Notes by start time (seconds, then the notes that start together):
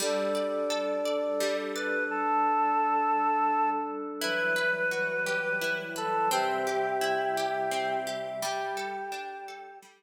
0.00 G3 D4 A4 D5
0.35 D5
0.70 A4
1.05 D5
1.40 G3
1.76 B4 D5
2.10 G3 D4 A4
4.20 E3 F#3 G3 E4 B4
4.56 B4
4.91 F#4
5.26 G4
5.61 E4
5.96 A4 B4
6.31 C3 G3 C4 G4 E5
6.67 G4
7.01 E4
7.37 G4
7.71 C4
8.07 G4
8.42 G3 G4
8.77 A4
9.12 D4
9.48 A4
9.82 G3